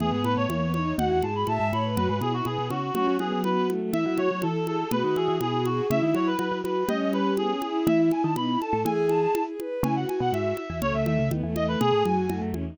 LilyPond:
<<
  \new Staff \with { instrumentName = "Clarinet" } { \time 2/2 \key e \major \tempo 2 = 122 gis'8 gis'8 b'8 cis''8 cis''4 cis''4 | fis''8 fis''8 a''8 b''8 a''4 b''4 | b'8 b'8 gis'8 fis'8 gis'4 fis'4 | fis'4 gis'4 b'4 r4 |
e''8 e''8 cis''4 a'4 a'4 | b'8 b'8 gis'4 gis'4 fis'4 | e''8 e''8 cis''8 b'8 b'4 b'4 | dis''8 dis''8 b'4 gis'4 gis'4 |
e''8 e''8 gis''8 a''8 b''4 a''4 | gis''4 a''8 a''4 r4. | gis''8 fis''8 gis''8 fis''8 e''2 | cis''8 e''8 e''4 r4 dis''8 b'8 |
gis'4 gis''4. r4. | }
  \new Staff \with { instrumentName = "Violin" } { \time 2/2 \key e \major b2 ais8 b8 dis'4 | fis'4 gis'4 e''4 cis''8 b'8 | fis'8 fis'8 e'8 e'8 b4 r4 | cis'4 b4 b4 a8 a8 |
e'4 fis'4 a'4 gis'8 gis'8 | fis'2 e'8 fis'8 gis'4 | e'2 r2 | cis'2 b8 cis'8 e'4 |
e'2 dis'8 e'8 a'4 | gis'2 e'8 gis'8 b'4 | e'8 fis'2~ fis'8 r4 | a2 b8 a8 a4 |
gis'4 fis'4 a4 cis'8 dis'8 | }
  \new Staff \with { instrumentName = "Vibraphone" } { \time 2/2 \key e \major <e, e>8 <gis, gis>8 <a, a>8 <a, a>8 <e, e>2 | <dis, dis>8 <e, e>8 <gis, gis>4 <a, a>8 <gis, gis>8 <a, a>4 | <fis, fis>8 <gis, gis>8 <b, b>4 <b, b>8 <b, b>8 <cis cis'>4 | <fis fis'>8 <fis fis'>8 <fis fis'>8 <fis fis'>8 <fis fis'>2 |
<e e'>8 <fis fis'>8 <fis fis'>8 <fis fis'>8 <e e'>2 | <b, b>8 <dis dis'>8 <e e'>8 <e e'>8 <b, b>2 | <cis cis'>8 <dis dis'>8 <fis fis'>4 <fis fis'>8 <fis fis'>8 <fis fis'>4 | <g g'>2. r4 |
<e e'>4 r8 <dis dis'>8 <b, b>4 r8 <a, a>8 | <e e'>2 r2 | <cis cis'>4 r8 <b, b>8 <gis, gis>4 r8 <e, e>8 | <cis, cis>8 <cis, cis>8 <dis, dis>8 <cis, cis>8 <dis, dis>8 <e, e>8 <e, e>4 |
<b, b>8 <a, a>8 <fis, fis>4 <fis, fis>8 <fis, fis>8 <e, e>4 | }
  \new DrumStaff \with { instrumentName = "Drums" } \drummode { \time 2/2 cgl4 cgho4 cgho4 cgho4 | cgl4 cgho4 cgho4 cgho4 | cgl4 cgho4 cgho4 cgho4 | cgl4 cgho4 cgho4 cgho4 |
cgl4 cgho4 cgho4 cgho4 | cgl4 cgho4 cgho4 cgho4 | cgl4 cgho4 cgho4 cgho4 | cgl4 cgho4 cgho4 cgho4 |
cgl4 cgho4 cgho4 cgho4 | cgl4 cgho4 cgho4 cgho4 | cgl4 cgho4 cgho4 cgho4 | cgl4 cgho4 cgho4 cgho4 |
cgl4 cgho4 cgho4 cgho4 | }
>>